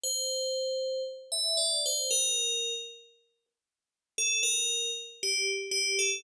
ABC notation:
X:1
M:2/2
L:1/8
Q:1/2=58
K:Cmix
V:1 name="Tubular Bells"
c4 z e d c | B3 z5 | A B2 z G z G A |]